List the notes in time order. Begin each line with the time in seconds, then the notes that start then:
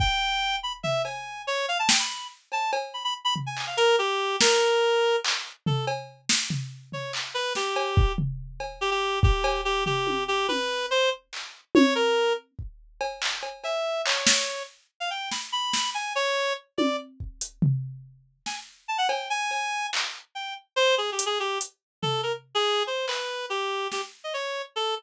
0.00 G5, kick
0.63 B5
0.83 E5, floor tom
1.04 G#5, cowbell
1.47 C#5
1.68 F5
1.79 A5
1.89 G5, snare
1.99 B5
2.52 A5, cowbell
2.73 cowbell
2.94 B5
3.04 B5
3.25 B5
3.36 floor tom
3.46 G#5
3.57 clap
3.67 F5
3.77 A#4, closed hi-hat
3.99 G4
4.41 A#4, snare
5.24 clap
5.66 A4, floor tom
5.87 cowbell
6.29 snare
6.50 floor tom
6.92 C#5, floor tom
7.13 clap
7.34 B4
7.55 G4, snare
7.76 cowbell
7.97 kick
8.18 floor tom
8.60 cowbell
8.81 G4
8.91 G4
9.23 G4, kick
9.44 cowbell
9.65 G4
9.86 G4, floor tom
10.07 high tom
10.28 G4
10.48 B4, high tom
10.91 C5
11.33 clap
11.75 C#5, high tom
11.95 A#4
12.59 kick
13.01 cowbell
13.22 clap
13.43 cowbell
13.64 E5, cowbell
14.06 C#5, clap
14.27 snare
15.00 F5
15.10 G5
15.31 B5, snare
15.52 B5
15.73 snare
15.94 G#5
16.15 C#5
16.78 D5, high tom
17.20 kick
17.41 closed hi-hat
17.62 floor tom
18.46 G#5, snare
18.88 A5
18.98 F#5
19.09 G5, cowbell
19.30 G#5
19.51 cowbell
19.93 clap
20.35 G5
20.76 C5
20.98 G#4
21.12 G4
21.19 closed hi-hat
21.26 G#4
21.40 G4
21.61 closed hi-hat
22.02 A4, floor tom
22.23 A#4
22.55 G#4
22.87 C5
23.08 B4, clap
23.50 G4
23.92 G4, snare
24.24 D#5
24.34 C#5
24.76 A4